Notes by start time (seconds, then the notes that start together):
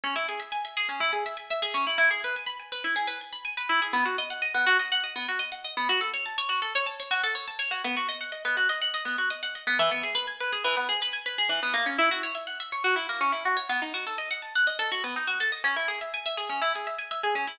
0.04 C#4
0.16 E4
0.29 G#4
0.40 E5
0.52 G#5
0.65 E5
0.77 G#4
0.89 C#4
1.00 E4
1.13 G#4
1.26 E5
1.37 G#5
1.50 E5
1.62 G#4
1.74 C#4
1.87 E4
1.98 E4
2.11 G#4
2.24 B4
2.36 G#5
2.46 B5
2.59 G#5
2.72 B4
2.84 E4
2.96 G#4
3.07 B4
3.21 G#5
3.33 B5
3.45 G#5
3.57 B4
3.69 E4
3.82 G#4
3.93 B3
4.05 F#4
4.18 D#5
4.30 F#5
4.42 D#5
4.54 B3
4.66 F#4
4.79 D#5
4.92 F#5
5.04 D#5
5.16 B3
5.28 F#4
5.39 D#5
5.52 F#5
5.64 D#5
5.77 B3
5.89 F#4
6.01 A4
6.14 C#5
6.26 A5
6.38 C#5
6.49 F#4
6.62 A4
6.75 C#5
6.86 A5
7.00 C#5
7.11 F#4
7.23 A4
7.35 C#5
7.48 A5
7.59 C#5
7.71 F#4
7.84 B3
7.97 F#4
8.09 D#5
8.21 F#5
8.32 D#5
8.45 B3
8.57 F#4
8.69 D#5
8.82 F#5
8.94 D#5
9.05 B3
9.18 F#4
9.30 D#5
9.43 F#5
9.55 D#5
9.67 B3
9.79 E3
9.91 B3
10.03 G#4
10.15 B4
10.27 G#5
10.40 B4
10.52 G#4
10.64 E3
10.77 B3
10.89 G#4
11.02 B4
11.13 G#5
11.26 B4
11.38 G#4
11.49 E3
11.63 B3
11.74 A#3
11.86 C#4
11.98 E4
12.11 F#4
12.23 C#5
12.35 E5
12.47 F#5
12.60 E5
12.72 C#5
12.84 F#4
12.96 E4
13.09 A#3
13.21 C#4
13.32 E4
13.45 F#4
13.57 C#5
13.69 B3
13.82 D#4
13.94 F#4
14.07 A4
14.18 D#5
14.31 F#5
14.42 A5
14.55 F#5
14.67 D#5
14.79 A4
14.92 F#4
15.04 B3
15.16 D#4
15.27 F#4
15.40 A4
15.52 D#5
15.64 C#4
15.76 E4
15.88 G#4
16.01 E5
16.14 G#5
16.26 E5
16.37 G#4
16.49 C#4
16.62 E4
16.75 G#4
16.87 E5
16.98 G#5
17.11 E5
17.23 G#4
17.35 C#4
17.47 E4